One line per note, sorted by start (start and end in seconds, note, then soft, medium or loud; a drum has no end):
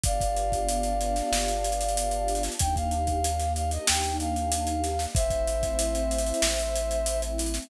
0.04 1.22 G1 loud
0.04 2.55 B3 loud
0.04 2.55 D4 medium
0.04 2.55 F4 medium
0.04 2.55 G4 medium
0.04 2.43 D5 medium
0.04 2.43 F5 medium
0.04 kick medium
0.04 closed hi-hat medium
0.21 kick medium
0.21 closed hi-hat medium
0.37 closed hi-hat medium
0.52 kick medium
0.52 closed hi-hat medium
0.69 closed hi-hat medium
0.83 closed hi-hat medium
1.01 closed hi-hat medium
1.16 snare soft
1.16 closed hi-hat medium
1.32 2.49 G1 loud
1.32 snare medium
1.48 closed hi-hat medium
1.64 closed hi-hat medium
1.72 closed hi-hat medium
1.81 closed hi-hat medium
1.89 closed hi-hat medium
1.97 closed hi-hat medium
2.11 closed hi-hat medium
2.28 closed hi-hat medium
2.35 closed hi-hat medium
2.43 snare medium
2.43 closed hi-hat medium
2.52 closed hi-hat medium
2.59 3.78 D#2 loud
2.59 5.11 A#3 medium
2.59 5.11 D4 medium
2.59 5.11 D#4 medium
2.59 5.11 G4 medium
2.59 2.75 G5 loud
2.59 kick medium
2.59 closed hi-hat loud
2.76 3.53 F5 medium
2.76 kick medium
2.76 closed hi-hat medium
2.91 closed hi-hat medium
3.07 kick medium
3.07 closed hi-hat medium
3.24 closed hi-hat medium
3.40 snare soft
3.40 closed hi-hat medium
3.56 3.71 F5 medium
3.56 closed hi-hat medium
3.71 3.87 D#5 medium
3.71 closed hi-hat medium
3.87 5.07 D#2 medium
3.87 4.16 G5 medium
3.87 snare loud
4.04 closed hi-hat medium
4.20 5.05 F5 medium
4.20 closed hi-hat medium
4.36 closed hi-hat medium
4.52 closed hi-hat loud
4.67 closed hi-hat medium
4.84 snare soft
4.84 closed hi-hat medium
4.99 snare medium
4.99 closed hi-hat medium
5.15 6.33 A1 loud
5.15 7.65 A3 medium
5.15 7.65 C4 medium
5.15 7.65 E4 loud
5.15 7.21 C5 loud
5.15 7.21 E5 loud
5.15 kick loud
5.15 closed hi-hat medium
5.30 kick medium
5.30 closed hi-hat medium
5.47 closed hi-hat medium
5.63 kick medium
5.63 closed hi-hat medium
5.79 closed hi-hat loud
5.95 closed hi-hat medium
6.11 closed hi-hat medium
6.18 closed hi-hat medium
6.27 closed hi-hat medium
6.34 closed hi-hat medium
6.42 7.60 A1 loud
6.42 snare loud
6.59 closed hi-hat medium
6.76 closed hi-hat medium
6.91 closed hi-hat medium
7.06 closed hi-hat medium
7.22 closed hi-hat medium
7.38 snare soft
7.38 closed hi-hat medium
7.46 closed hi-hat medium
7.54 snare medium
7.54 closed hi-hat medium
7.62 closed hi-hat medium